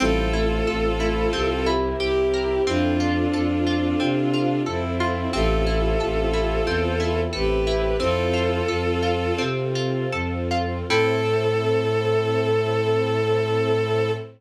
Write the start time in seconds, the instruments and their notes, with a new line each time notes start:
0.00 violin A1 F4 A4, ocarina G3 E4, string ensemble 1 C4 E4 A4, orchestral harp C4
0.33 ocarina A3 F4, orchestral harp E4
0.67 violin A1, orchestral harp A4
1.00 ocarina A3 F4, orchestral harp E4
1.33 violin C2, orchestral harp C4, string ensemble 1 C4 E4 G4 A#4
1.66 orchestral harp E4
2.00 violin C2 E4 G4, orchestral harp G4
2.34 orchestral harp A#4
2.67 violin F2 D4 F4, orchestral harp C4, string ensemble 1 C4 F4 A4, ocarina E4 C5
3.00 ocarina F4 D5, orchestral harp F4
3.33 violin F2, orchestral harp A4
3.67 orchestral harp F4, ocarina F4 D5
4.00 violin C3, orchestral harp C4
4.33 orchestral harp F4
4.66 violin F2 C4 E4, orchestral harp A4
5.00 orchestral harp F4
5.33 violin A1 F4 A4, orchestral harp C4, string ensemble 1 C4 E4 A4, ocarina G4 E5
5.67 orchestral harp E4, ocarina G4 E5
6.00 violin A1, orchestral harp A4
6.33 orchestral harp E4, ocarina G4 E5
6.66 violin E2, orchestral harp C4
7.00 orchestral harp E4
7.33 violin A1 G4 B4, orchestral harp A4
7.67 orchestral harp E4
8.00 violin F2 F4 A4, orchestral harp C4, string ensemble 1 C4 F4 A4, ocarina E4 C5
8.33 orchestral harp F4
8.68 violin F2, orchestral harp A4
9.03 orchestral harp F4
9.38 violin C3, orchestral harp C4
9.75 orchestral harp F4
10.12 violin F2, orchestral harp A4
10.51 orchestral harp F4
10.89 violin A2 A4, orchestral harp C4 E4 A4, string ensemble 1 C4 E4 A4, ocarina A4